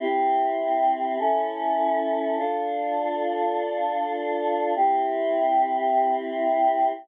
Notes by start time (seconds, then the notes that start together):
0.00 C4 E4 G4
1.19 C#4 E4 A4
2.38 D4 F4 A4
4.75 C4 E4 G4